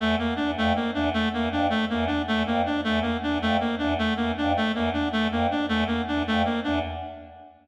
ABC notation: X:1
M:6/4
L:1/8
Q:1/4=158
K:none
V:1 name="Choir Aahs" clef=bass
E,, z E,, F,, z E,, z E,, F,, z E,, z | E,, F,, z E,, z E,, F,, z E,, z E,, F,, | z E,, z E,, F,, z E,, z E,, F,, z E,, |]
V:2 name="Clarinet"
A, _B, D A, B, D A, B, D A, B, D | A, _B, D A, B, D A, B, D A, B, D | A, _B, D A, B, D A, B, D A, B, D |]